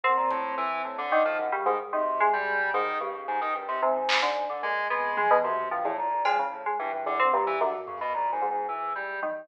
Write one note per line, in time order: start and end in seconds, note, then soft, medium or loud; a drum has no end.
0.03 0.16 F#2 medium
0.03 1.01 A#2 loud
0.03 1.01 C4 medium
0.17 0.29 A#2 medium
0.31 0.55 A2 loud
0.31 kick medium
0.58 0.82 E3 loud
0.85 0.97 A2 medium
0.98 1.22 D3 loud
1.12 1.48 D#3 medium
1.25 1.37 F3 loud
1.39 1.51 F#2 medium
1.52 1.64 C#3 medium
1.52 1.64 G3 medium
1.66 1.90 G#2 medium
1.66 1.78 D#3 medium
1.93 2.91 B2 medium
1.93 2.29 C3 medium
1.93 2.17 D#3 medium
2.20 2.69 G#3 medium
2.33 2.70 G3 medium
2.74 2.98 G#2 medium
2.74 2.98 D#3 loud
3.00 3.49 G2 medium
3.00 3.13 C#3 medium
3.14 3.26 C#3 soft
3.28 3.40 G#2 loud
3.41 3.53 D#3 loud
3.55 3.67 G2 medium
3.55 3.79 A#2 medium
3.68 3.81 C3 loud
3.82 3.94 G#2 medium
3.82 4.19 C3 loud
3.82 4.56 C#3 medium
3.95 4.44 G#2 medium
4.09 clap loud
4.22 4.59 D3 medium
4.49 4.62 D3 medium
4.63 4.87 A#2 medium
4.63 4.87 C3 medium
4.63 4.87 G#3 loud
4.90 5.63 F2 loud
4.90 5.39 G#3 medium
4.90 5.14 B3 medium
5.17 5.29 G#3 medium
5.17 high tom medium
5.30 5.43 B2 loud
5.44 5.68 F#2 medium
5.44 5.68 C3 medium
5.44 floor tom medium
5.71 5.83 G2 medium
5.71 5.95 A2 loud
5.71 5.83 F3 medium
5.85 5.97 E2 medium
5.85 5.97 A2 loud
5.98 6.71 C2 medium
5.98 6.22 A#2 medium
6.25 6.37 F3 medium
6.25 6.37 G#3 medium
6.25 cowbell medium
6.39 6.63 C#3 medium
6.52 6.64 A2 medium
6.66 6.78 G#3 medium
6.79 6.91 G2 loud
6.79 7.52 A#2 medium
6.79 7.04 E3 medium
6.93 7.05 G2 medium
7.06 7.18 E2 medium
7.06 7.18 D3 loud
7.19 7.32 D3 medium
7.19 7.31 C4 medium
7.33 7.57 G2 loud
7.33 7.45 A#2 medium
7.47 7.59 E3 loud
7.60 8.34 F#2 loud
7.60 7.78 G2 loud
7.60 7.72 D3 medium
7.78 7.94 F3 medium
7.87 7.99 C#3 medium
7.87 floor tom loud
7.96 8.12 F#2 loud
8.01 8.13 B2 loud
8.13 8.29 G#2 medium
8.13 8.31 A#2 medium
8.32 8.49 G#2 medium
8.32 8.50 A#2 loud
8.41 9.14 G#2 medium
8.50 8.67 G#2 medium
8.50 8.68 B2 medium
8.68 9.41 D2 medium
8.68 8.93 E3 medium
8.95 9.20 G3 medium
9.22 9.47 D#3 medium
9.22 high tom medium